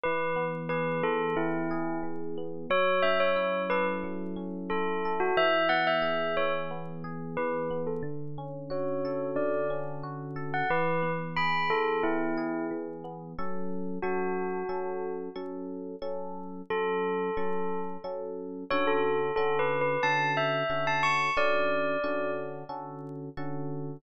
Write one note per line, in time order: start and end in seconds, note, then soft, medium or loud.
0.03 1.03 E3 loud
0.03 0.44 B4 medium
0.36 1.36 B3 medium
0.69 1.70 G#4 medium
0.69 1.02 B4 medium
1.03 2.03 E3 medium
1.03 1.35 A4 medium
1.36 2.37 B3 loud
1.36 1.98 E4 medium
1.71 2.66 G#4 medium
2.03 2.66 E3 medium
2.38 2.69 B3 medium
2.70 4.03 F#3 loud
2.70 3.01 C#5 medium
3.02 4.36 C#4 medium
3.02 3.18 E5 medium
3.20 3.62 C#5 medium
3.36 4.70 E4 medium
3.70 5.05 A4 medium
3.70 3.86 B4 medium
4.04 5.30 F#3 medium
4.36 5.31 C#4 medium
4.70 5.34 E4 medium
4.70 5.13 A4 medium
5.05 5.37 A4 medium
5.20 5.36 F#4 medium
5.37 6.37 E3 loud
5.37 5.68 E5 medium
5.69 6.70 B3 medium
5.69 5.85 F#5 medium
5.87 6.35 E5 medium
6.02 7.03 G#4 medium
6.37 7.37 E3 medium
6.37 6.53 C#5 medium
6.71 7.70 B3 medium
7.04 7.99 G#4 medium
7.37 8.01 E3 medium
7.37 7.81 B4 medium
7.71 8.02 B3 medium
7.87 8.03 A4 medium
8.03 9.35 D3 loud
8.38 9.70 C#4 medium
8.70 10.03 F#4 medium
8.70 9.26 C#5 medium
9.05 10.35 A4 medium
9.36 10.62 D3 loud
9.36 9.68 D5 medium
9.70 10.65 C#4 medium
10.03 10.67 F#4 medium
10.36 10.68 A4 medium
10.54 10.69 F#5 medium
10.70 11.69 E3 loud
10.70 11.11 B4 medium
11.02 12.03 B3 medium
11.36 12.37 G#4 medium
11.36 11.69 B5 medium
11.70 12.70 E3 medium
11.70 12.02 A4 medium
12.03 13.04 B3 medium
12.03 12.65 E4 medium
12.37 13.32 G#4 medium
12.71 13.34 E3 medium
13.04 13.36 B3 medium
13.38 13.98 F#3 medium
13.38 13.98 C#4 medium
13.38 13.98 A4 medium
14.02 14.63 F#3 medium
14.02 14.63 C#4 medium
14.02 15.09 F#4 medium
14.02 14.63 A4 medium
14.69 15.29 F#3 medium
14.69 15.29 C#4 medium
14.69 15.29 A4 medium
15.36 15.96 F#3 medium
15.36 15.96 C#4 medium
15.36 15.96 A4 medium
16.02 16.62 F#3 medium
16.02 16.62 C#4 medium
16.02 16.62 A4 medium
16.70 17.30 F#3 medium
16.70 17.30 C#4 medium
16.70 17.30 A4 medium
16.70 17.79 A4 medium
17.37 17.97 F#3 medium
17.37 17.97 C#4 medium
17.37 17.97 A4 medium
18.04 18.64 F#3 medium
18.04 18.64 C#4 medium
18.04 18.64 A4 medium
18.70 19.31 D3 medium
18.70 19.31 C#4 medium
18.70 19.31 F#4 loud
18.70 19.31 A4 loud
18.70 18.86 C#5 medium
18.87 19.32 A4 medium
19.36 19.97 D3 medium
19.36 19.97 C#4 medium
19.36 19.97 F#4 medium
19.36 19.57 A4 medium
19.36 19.97 A4 medium
19.59 19.80 B4 medium
19.81 20.02 B4 medium
20.03 20.63 D3 medium
20.03 20.63 C#4 medium
20.03 20.63 F#4 medium
20.03 20.63 A4 medium
20.03 20.31 A5 medium
20.37 20.85 E5 medium
20.70 21.30 D3 medium
20.70 21.30 C#4 medium
20.70 21.30 F#4 medium
20.70 21.30 A4 medium
20.87 21.03 A5 medium
21.03 21.31 C#6 medium
21.37 21.97 D3 medium
21.37 21.97 C#4 medium
21.37 21.97 F#4 medium
21.37 21.97 A4 medium
21.37 22.31 D5 medium
22.04 22.64 D3 medium
22.04 22.64 C#4 medium
22.04 22.64 F#4 medium
22.04 22.64 A4 medium
22.69 23.29 D3 medium
22.69 23.29 C#4 medium
22.69 23.29 F#4 medium
22.69 23.29 A4 medium
23.37 23.97 D3 medium
23.37 23.97 C#4 medium
23.37 23.97 F#4 medium
23.37 23.97 A4 medium